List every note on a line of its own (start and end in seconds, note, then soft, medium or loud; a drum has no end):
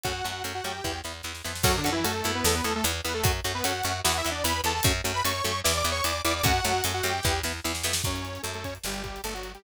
0.04 0.22 F#2 medium
0.04 0.12 A3 medium
0.04 0.12 C#4 medium
0.04 0.43 F#4 medium
0.04 0.12 F#4 medium
0.04 0.43 F#5 medium
0.04 kick loud
0.04 closed hi-hat medium
0.24 0.42 F#2 medium
0.24 0.32 A3 medium
0.24 0.32 C#4 medium
0.24 0.32 F#4 medium
0.24 closed hi-hat medium
0.44 0.61 F#2 medium
0.44 0.53 A3 medium
0.44 0.53 C#4 medium
0.44 0.53 F#4 medium
0.44 closed hi-hat loud
0.55 0.64 F#4 medium
0.55 0.64 F#5 medium
0.64 0.81 F#2 medium
0.64 0.73 A3 medium
0.64 0.73 C#4 medium
0.64 0.73 F#4 medium
0.64 1.00 G4 medium
0.64 1.00 G5 medium
0.64 closed hi-hat medium
0.84 1.02 E2 medium
0.84 0.92 B3 medium
0.84 0.92 E4 medium
0.84 kick medium
0.84 snare medium
1.04 1.22 E2 medium
1.04 1.12 B3 medium
1.04 1.12 E4 medium
1.04 snare medium
1.23 1.42 E2 medium
1.23 1.32 B3 medium
1.23 1.32 E4 medium
1.23 snare medium
1.35 snare medium
1.44 1.63 F2 medium
1.44 1.53 B3 medium
1.44 1.53 E4 medium
1.44 snare medium
1.55 snare medium
1.63 1.81 F#2 loud
1.63 1.76 F#3 loud
1.63 1.72 C#4 loud
1.63 1.76 F#4 loud
1.63 1.72 F#4 loud
1.63 1.72 A4 loud
1.63 kick loud
1.63 crash loud
1.77 1.90 D3 medium
1.77 1.90 D4 loud
1.84 2.03 F#2 medium
1.84 1.92 C#4 loud
1.84 1.92 F#4 medium
1.84 1.92 A4 medium
1.84 closed hi-hat medium
1.92 2.05 E3 loud
1.92 2.05 E4 loud
2.04 2.22 F#2 medium
2.04 2.31 A3 medium
2.04 2.12 C#4 medium
2.04 2.12 F#4 loud
2.04 2.12 A4 medium
2.04 2.31 A4 loud
2.04 closed hi-hat loud
2.24 2.42 F#2 medium
2.24 2.53 B3 loud
2.24 2.53 E4 loud
2.24 closed hi-hat loud
2.35 2.44 B3 medium
2.35 2.44 B4 medium
2.44 2.61 E2 loud
2.44 2.55 A3 medium
2.44 2.55 A4 loud
2.44 snare loud
2.55 2.65 B3 medium
2.55 2.65 B4 medium
2.64 2.81 E2 medium
2.64 2.74 A3 medium
2.64 2.72 B3 loud
2.64 2.72 E4 loud
2.64 2.74 A4 medium
2.64 closed hi-hat medium
2.76 2.85 A3 medium
2.76 2.85 A4 loud
2.84 3.01 E2 loud
2.84 2.92 B3 loud
2.84 2.92 E4 loud
2.84 closed hi-hat loud
3.05 3.22 E2 medium
3.05 3.12 B3 medium
3.05 3.14 B3 medium
3.05 3.12 E4 loud
3.05 3.14 B4 medium
3.05 closed hi-hat loud
3.14 3.24 A3 medium
3.14 3.24 A4 loud
3.24 3.41 F#2 loud
3.24 3.32 A3 medium
3.24 3.32 C#4 loud
3.24 3.32 F#4 loud
3.24 kick loud
3.24 closed hi-hat loud
3.44 3.62 F#2 medium
3.44 3.52 A3 medium
3.44 3.52 C#4 loud
3.44 3.52 F#4 loud
3.44 closed hi-hat medium
3.55 3.64 B3 medium
3.55 3.64 B4 loud
3.64 3.82 F#2 medium
3.64 3.73 A3 medium
3.64 3.73 C#4 medium
3.64 4.00 F#4 medium
3.64 3.73 F#4 medium
3.64 4.00 F#5 medium
3.64 closed hi-hat loud
3.84 4.02 F#2 medium
3.84 3.93 A3 medium
3.84 3.93 C#4 medium
3.84 3.93 F#4 loud
3.84 closed hi-hat loud
4.04 4.22 E2 loud
4.04 4.12 B3 loud
4.04 4.12 E4 loud
4.04 4.17 F#4 medium
4.04 4.17 F#5 medium
4.04 snare loud
4.17 4.30 E4 loud
4.17 4.30 E5 loud
4.25 4.43 E2 medium
4.25 4.33 B3 medium
4.25 4.33 E4 loud
4.25 closed hi-hat medium
4.31 4.44 D4 medium
4.31 4.44 D5 medium
4.44 4.61 E2 loud
4.44 4.53 B3 loud
4.44 4.53 E4 medium
4.44 4.61 B4 medium
4.44 4.61 B5 loud
4.44 closed hi-hat loud
4.64 4.81 E2 medium
4.64 4.73 B3 loud
4.64 4.73 E4 loud
4.64 4.74 A4 medium
4.64 4.74 A5 loud
4.64 closed hi-hat medium
4.74 4.84 A4 medium
4.74 4.84 A5 medium
4.83 5.01 F#2 loud
4.83 4.92 A3 loud
4.83 4.92 C#4 loud
4.83 4.92 F#4 loud
4.83 kick loud
4.83 closed hi-hat loud
5.04 5.22 F#2 medium
5.04 5.12 A3 medium
5.04 5.12 C#4 medium
5.04 5.12 F#4 loud
5.04 closed hi-hat loud
5.14 5.23 B4 medium
5.14 5.23 B5 loud
5.24 5.42 F#2 medium
5.24 5.32 A3 loud
5.24 5.32 C#4 medium
5.24 5.32 F#4 loud
5.24 5.61 C#5 medium
5.24 5.61 C#6 loud
5.24 closed hi-hat loud
5.44 5.62 F#2 medium
5.44 5.52 A3 medium
5.44 5.52 C#4 medium
5.44 5.52 F#4 medium
5.44 closed hi-hat medium
5.64 5.83 E2 loud
5.64 5.73 B3 loud
5.64 5.73 E4 loud
5.64 5.77 D5 medium
5.64 5.77 D6 medium
5.64 snare loud
5.77 5.90 D5 medium
5.77 5.90 D6 loud
5.84 6.01 E2 medium
5.84 5.93 B3 loud
5.84 5.93 E4 loud
5.84 closed hi-hat medium
5.92 6.04 C#5 medium
5.92 6.04 C#6 loud
6.04 6.21 E2 medium
6.04 6.12 B3 medium
6.04 6.12 E4 medium
6.04 6.22 D5 medium
6.04 6.22 D6 medium
6.04 closed hi-hat loud
6.25 6.42 E2 loud
6.25 6.33 B3 loud
6.25 6.33 E4 loud
6.25 6.34 D5 medium
6.25 6.34 D6 loud
6.25 closed hi-hat loud
6.36 6.46 D5 medium
6.36 6.46 D6 medium
6.43 6.60 F#2 loud
6.43 6.52 A3 loud
6.43 6.52 C#4 loud
6.43 6.52 F#4 loud
6.43 6.84 F#4 loud
6.43 6.84 F#5 loud
6.43 kick loud
6.43 closed hi-hat loud
6.65 6.82 F#2 medium
6.65 6.73 A3 loud
6.65 6.73 C#4 medium
6.65 6.73 F#4 medium
6.65 closed hi-hat loud
6.84 7.02 F#2 medium
6.84 6.92 A3 loud
6.84 6.92 C#4 medium
6.84 6.92 F#4 medium
6.84 closed hi-hat loud
6.94 7.03 F#4 medium
6.94 7.03 F#5 medium
7.03 7.20 F#2 loud
7.03 7.12 A3 medium
7.03 7.12 C#4 medium
7.03 7.12 F#4 loud
7.03 7.40 G4 medium
7.03 7.40 G5 medium
7.03 closed hi-hat medium
7.23 7.42 E2 loud
7.23 7.33 B3 loud
7.23 7.33 E4 loud
7.23 kick loud
7.23 snare medium
7.43 7.60 E2 medium
7.43 7.53 B3 medium
7.43 7.53 E4 loud
7.43 snare medium
7.64 7.83 E2 medium
7.64 7.72 B3 loud
7.64 7.72 E4 loud
7.64 snare medium
7.75 snare loud
7.83 8.02 F2 medium
7.83 7.93 B3 loud
7.83 7.93 E4 loud
7.83 snare loud
7.93 snare loud
8.04 8.38 F#2 medium
8.04 8.42 C#4 medium
8.04 8.42 C#5 medium
8.04 kick loud
8.04 crash medium
8.16 closed hi-hat medium
8.25 closed hi-hat medium
8.35 closed hi-hat medium
8.43 8.78 F#2 medium
8.43 8.52 A3 medium
8.43 8.52 A4 medium
8.43 closed hi-hat medium
8.54 8.64 A3 medium
8.54 8.64 A4 medium
8.54 closed hi-hat medium
8.64 8.74 C#4 medium
8.64 8.74 C#5 medium
8.64 kick medium
8.64 closed hi-hat medium
8.75 closed hi-hat medium
8.84 9.19 G1 medium
8.84 9.02 G3 medium
8.84 9.02 G4 medium
8.84 snare loud
8.94 closed hi-hat medium
9.03 9.21 G3 medium
9.03 9.21 G4 medium
9.03 kick medium
9.03 closed hi-hat medium
9.16 closed hi-hat medium
9.24 9.58 G1 medium
9.24 9.34 A3 medium
9.24 9.34 A4 medium
9.24 closed hi-hat loud
9.34 9.52 F#3 medium
9.34 9.52 F#4 medium
9.34 closed hi-hat medium
9.43 closed hi-hat medium
9.54 9.63 G3 medium
9.54 9.63 G4 medium
9.54 closed hi-hat medium